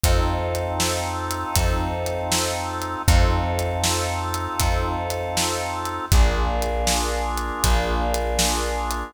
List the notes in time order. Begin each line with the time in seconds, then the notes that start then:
0.03 F2 C4 D#4 F4 A4, kick, closed hi-hat
0.55 closed hi-hat
0.80 snare
1.31 closed hi-hat
1.56 F2, kick, closed hi-hat
2.06 closed hi-hat
2.32 snare
2.82 closed hi-hat
3.08 F2 C4 D#4 F4 A4, kick, closed hi-hat
3.59 closed hi-hat
3.84 snare
4.34 closed hi-hat
4.60 F2, kick, closed hi-hat
5.10 closed hi-hat
5.37 snare
5.85 closed hi-hat
6.12 A#1 A#3 D4 F4 G#4, kick, closed hi-hat
6.62 closed hi-hat
6.87 snare
7.38 closed hi-hat
7.64 A#1, kick, closed hi-hat
8.14 closed hi-hat
8.39 snare
8.91 closed hi-hat